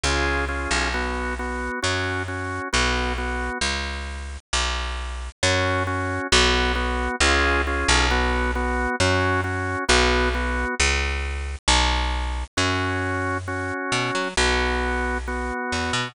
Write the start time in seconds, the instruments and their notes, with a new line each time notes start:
0.03 electric bass (finger) C#2, drawbar organ C#4 F4 G#4
0.49 drawbar organ C#4 F4 G#4
0.71 electric bass (finger) B1
0.94 drawbar organ B3 F#4
1.39 drawbar organ B3 F#4
1.82 electric bass (finger) F#2, drawbar organ C#4 F#4
2.28 drawbar organ C#4 F#4
2.73 electric bass (finger) B1, drawbar organ B3 F#4
3.18 drawbar organ B3 F#4
3.61 electric bass (finger) C#2
4.53 electric bass (finger) B1
5.43 electric bass (finger) F#2, drawbar organ C#4 F#4
5.87 drawbar organ C#4 F#4
6.32 electric bass (finger) B1, drawbar organ B3 F#4
6.75 drawbar organ B3 F#4
7.20 electric bass (finger) C#2, drawbar organ C#4 F4 G#4
7.67 drawbar organ C#4 F4 G#4
7.88 electric bass (finger) B1
8.11 drawbar organ B3 F#4
8.55 drawbar organ B3 F#4
9.00 electric bass (finger) F#2, drawbar organ C#4 F#4
9.44 drawbar organ C#4 F#4
9.89 electric bass (finger) B1, drawbar organ B3 F#4
10.34 drawbar organ B3 F#4
10.80 electric bass (finger) C#2
11.68 electric bass (finger) B1
12.57 electric bass (finger) F#2, drawbar organ C#4 F#4
13.48 drawbar organ C#4 F#4
13.92 electric bass (finger) B2
14.15 electric bass (finger) F#3
14.37 electric bass (finger) B1, drawbar organ B3 F#4
15.28 drawbar organ B3 F#4
15.72 electric bass (finger) E2
15.93 electric bass (finger) B2